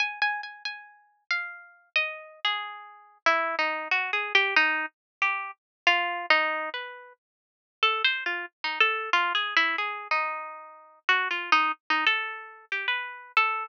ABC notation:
X:1
M:3/4
L:1/16
Q:1/4=92
K:none
V:1 name="Orchestral Harp"
(3^g2 g2 g2 g4 f4 | ^d3 ^G5 E2 ^D2 | (3^F2 ^G2 =G2 ^D2 z2 G2 z2 | (3F4 ^D4 B4 z4 |
(3A2 c2 F2 z ^D A2 (3F2 ^G2 E2 | ^G2 ^D6 (3^F2 =F2 D2 | z ^D A4 G B3 A2 |]